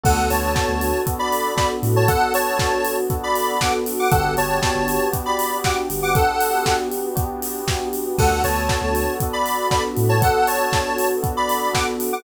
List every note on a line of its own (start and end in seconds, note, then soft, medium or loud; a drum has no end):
0.03 0.16 D2 medium
0.03 0.49 B3 medium
0.03 4.08 B3 medium
0.03 0.49 D4 medium
0.03 4.08 D4 medium
0.03 0.49 F#4 medium
0.03 4.08 F#4 medium
0.03 0.49 A4 medium
0.03 4.08 A4 medium
0.03 0.28 A4 medium
0.03 0.28 F#5 medium
0.03 kick loud
0.03 crash loud
0.17 0.29 D2 medium
0.30 0.54 D2 medium
0.30 1.00 C#5 medium
0.30 1.00 A5 medium
0.30 open hi-hat medium
0.55 1.00 B3 medium
0.55 1.00 D4 medium
0.55 1.00 F#4 medium
0.55 1.00 A4 medium
0.55 kick loud
0.55 snare loud
0.68 0.91 D2 medium
0.81 open hi-hat medium
1.06 1.52 B3 medium
1.06 1.52 D4 medium
1.06 1.52 F#4 medium
1.06 1.52 A4 medium
1.06 kick loud
1.06 closed hi-hat loud
1.19 1.54 D5 medium
1.19 1.54 B5 medium
1.32 open hi-hat medium
1.56 2.02 B3 medium
1.56 2.02 D4 medium
1.56 2.02 F#4 medium
1.56 2.02 A4 medium
1.56 1.69 D5 medium
1.56 1.69 B5 medium
1.56 kick loud
1.56 snare loud
1.83 2.05 A2 medium
1.83 open hi-hat medium
1.96 2.08 C#5 medium
1.96 2.08 A5 medium
2.08 2.55 B3 medium
2.08 2.55 D4 medium
2.08 2.55 F#4 medium
2.08 2.33 A4 medium
2.08 2.55 A4 medium
2.08 2.33 F#5 loud
2.08 kick loud
2.08 closed hi-hat loud
2.34 2.96 C#5 medium
2.34 2.96 A5 medium
2.34 open hi-hat loud
2.58 3.03 B3 medium
2.58 3.03 D4 medium
2.58 3.03 F#4 medium
2.58 3.03 A4 medium
2.58 kick loud
2.58 snare loud
2.85 open hi-hat loud
3.10 3.56 B3 medium
3.10 3.56 D4 medium
3.10 3.56 F#4 medium
3.10 3.56 A4 medium
3.10 kick loud
3.10 closed hi-hat loud
3.23 3.59 D5 medium
3.23 3.59 B5 medium
3.35 open hi-hat medium
3.61 4.08 B3 loud
3.61 4.08 D4 medium
3.61 4.08 F#4 medium
3.61 4.08 A4 medium
3.61 3.73 F#5 medium
3.61 3.73 D6 medium
3.61 kick medium
3.61 snare loud
3.86 open hi-hat loud
3.99 4.11 F#5 medium
3.99 4.11 D6 medium
4.11 4.23 G1 medium
4.11 4.58 B3 loud
4.11 8.16 B3 medium
4.11 4.58 D4 medium
4.11 8.16 D4 medium
4.11 4.58 F#4 loud
4.11 8.16 F#4 medium
4.11 4.58 G4 loud
4.11 8.16 G4 medium
4.11 4.34 A4 medium
4.11 4.34 F#5 medium
4.11 kick loud
4.11 closed hi-hat loud
4.25 4.36 G1 medium
4.37 4.60 G1 medium
4.37 5.08 C#5 medium
4.37 5.08 A5 medium
4.37 open hi-hat medium
4.62 5.08 B3 loud
4.62 5.08 D4 medium
4.62 5.08 F#4 medium
4.62 5.08 G4 medium
4.62 kick loud
4.62 snare loud
4.75 4.98 G1 medium
4.88 open hi-hat medium
5.12 5.58 B3 medium
5.12 5.58 D4 medium
5.12 5.58 F#4 medium
5.12 5.58 G4 medium
5.12 kick loud
5.12 closed hi-hat loud
5.26 5.57 D5 medium
5.26 5.57 B5 medium
5.39 open hi-hat loud
5.64 6.11 B3 medium
5.64 6.11 D4 medium
5.64 6.11 F#4 medium
5.64 6.11 G4 medium
5.64 5.77 F#5 medium
5.64 5.77 D6 medium
5.64 kick loud
5.64 snare loud
5.90 6.13 G1 medium
5.90 open hi-hat loud
6.02 6.15 F#5 medium
6.02 6.15 D6 medium
6.15 6.60 B3 medium
6.15 6.60 D4 medium
6.15 6.60 F#4 medium
6.15 6.60 G4 medium
6.15 6.76 A4 medium
6.15 6.76 F#5 medium
6.15 kick loud
6.15 closed hi-hat loud
6.41 open hi-hat loud
6.65 7.11 B3 medium
6.65 7.11 D4 medium
6.65 7.11 F#4 medium
6.65 7.11 G4 medium
6.65 kick medium
6.65 snare loud
6.92 open hi-hat medium
7.16 7.61 B3 medium
7.16 7.61 D4 medium
7.16 7.61 F#4 medium
7.16 7.61 G4 medium
7.16 kick loud
7.16 closed hi-hat loud
7.42 open hi-hat loud
7.67 8.13 B3 medium
7.67 8.13 D4 medium
7.67 8.13 F#4 medium
7.67 8.13 G4 medium
7.67 kick loud
7.67 snare loud
7.93 open hi-hat medium
8.18 8.30 D2 medium
8.18 8.65 B3 medium
8.18 12.23 B3 medium
8.18 8.65 D4 medium
8.18 12.23 D4 medium
8.18 8.65 F#4 medium
8.18 12.23 F#4 medium
8.18 8.65 A4 medium
8.18 8.42 A4 medium
8.18 12.23 A4 medium
8.18 8.42 F#5 medium
8.18 kick loud
8.18 crash loud
8.31 8.42 D2 medium
8.44 8.67 D2 medium
8.44 9.14 C#5 medium
8.44 9.14 A5 medium
8.44 open hi-hat medium
8.68 9.14 B3 medium
8.68 9.14 D4 medium
8.68 9.14 F#4 medium
8.68 9.14 A4 medium
8.68 kick loud
8.68 snare loud
8.81 9.04 D2 medium
8.95 open hi-hat medium
9.20 9.68 B3 medium
9.20 9.68 D4 medium
9.20 9.68 F#4 medium
9.20 9.68 A4 medium
9.20 kick loud
9.20 closed hi-hat loud
9.33 9.68 D5 medium
9.33 9.68 B5 medium
9.46 open hi-hat medium
9.71 10.16 B3 medium
9.71 10.16 D4 medium
9.71 10.16 F#4 medium
9.71 10.16 A4 medium
9.71 9.83 D5 medium
9.71 9.83 B5 medium
9.71 kick loud
9.71 snare loud
9.97 10.20 A2 medium
9.97 open hi-hat medium
10.09 10.21 C#5 medium
10.09 10.21 A5 medium
10.21 10.67 B3 medium
10.21 10.67 D4 medium
10.21 10.67 F#4 medium
10.21 10.67 A4 medium
10.21 10.47 A4 medium
10.21 10.47 F#5 loud
10.21 kick loud
10.21 closed hi-hat loud
10.47 11.09 C#5 medium
10.47 11.09 A5 medium
10.47 open hi-hat loud
10.73 11.19 B3 medium
10.73 11.19 D4 medium
10.73 11.19 F#4 medium
10.73 11.19 A4 medium
10.73 kick loud
10.73 snare loud
10.98 open hi-hat loud
11.23 11.69 B3 medium
11.23 11.69 D4 medium
11.23 11.69 F#4 medium
11.23 11.69 A4 medium
11.23 kick loud
11.23 closed hi-hat loud
11.37 11.73 D5 medium
11.37 11.73 B5 medium
11.49 open hi-hat medium
11.73 12.19 B3 loud
11.73 12.19 D4 medium
11.73 12.19 F#4 medium
11.73 12.19 A4 medium
11.73 11.86 F#5 medium
11.73 11.86 D6 medium
11.73 kick medium
11.73 snare loud
12.00 open hi-hat loud
12.13 12.23 F#5 medium
12.13 12.23 D6 medium